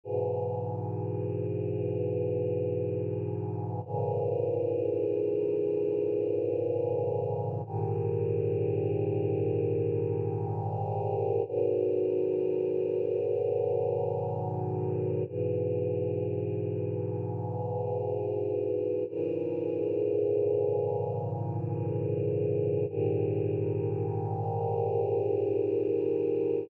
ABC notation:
X:1
M:4/4
L:1/8
Q:1/4=63
K:G#m
V:1 name="Choir Aahs" clef=bass
[G,,B,,E,]8 | [G,,A,,C,E,]8 | [G,,A,,D,=G,]8 | [G,,B,,D,F,]8 |
[G,,B,,E,]8 | [G,,A,,C,E,]8 | [G,,A,,D,=G,]8 |]